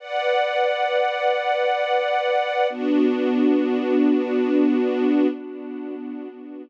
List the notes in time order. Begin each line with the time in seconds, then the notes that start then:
0.00 B4 D5 F#5
2.70 B3 D4 F#4